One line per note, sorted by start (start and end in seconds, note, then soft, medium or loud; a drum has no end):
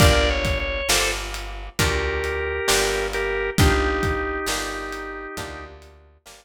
0.00 0.82 G1 loud
0.00 0.81 A#3 medium
0.00 0.81 D4 medium
0.00 0.81 F4 medium
0.00 0.81 G4 medium
0.00 0.29 A#4 medium
0.00 0.29 D5 medium
0.00 kick loud
0.00 closed hi-hat loud
0.30 0.58 C#5 medium
0.45 kick medium
0.45 closed hi-hat medium
0.60 0.88 C#5 medium
0.89 1.69 G1 medium
0.89 1.70 A#3 medium
0.89 1.70 D4 medium
0.89 1.70 F4 medium
0.89 1.70 G4 medium
0.89 1.11 A4 medium
0.89 1.11 C5 medium
0.89 snare loud
1.34 closed hi-hat medium
1.79 2.60 D2 loud
1.79 2.60 A#3 medium
1.79 2.60 D4 medium
1.79 2.60 F4 medium
1.79 3.07 G4 medium
1.79 2.60 G4 medium
1.79 3.07 A#4 medium
1.79 kick loud
1.79 closed hi-hat loud
2.24 closed hi-hat medium
2.68 3.51 G1 medium
2.68 3.49 A#3 medium
2.68 3.49 D4 medium
2.68 3.49 F4 medium
2.68 3.49 G4 medium
2.68 snare loud
3.13 3.50 G4 medium
3.13 3.50 A#4 medium
3.13 closed hi-hat medium
3.58 4.39 G1 medium
3.58 4.40 A#3 medium
3.58 4.40 D4 medium
3.58 5.65 D#4 medium
3.58 4.40 F4 medium
3.58 5.65 G4 medium
3.58 4.40 G4 medium
3.58 kick loud
3.58 closed hi-hat loud
4.03 kick loud
4.03 closed hi-hat medium
4.46 5.27 G1 medium
4.46 5.29 A#3 medium
4.46 5.29 D4 medium
4.46 5.29 F4 medium
4.46 5.29 G4 medium
4.46 snare loud
4.93 closed hi-hat medium
5.37 6.18 D2 loud
5.37 6.18 A#3 medium
5.37 6.18 D4 medium
5.37 6.18 F4 medium
5.37 6.18 G4 medium
5.37 kick loud
5.37 closed hi-hat loud
5.82 closed hi-hat medium
6.26 6.45 G1 medium
6.26 6.45 A#3 medium
6.26 6.45 D4 medium
6.26 6.45 F4 medium
6.26 6.45 G4 medium
6.26 snare loud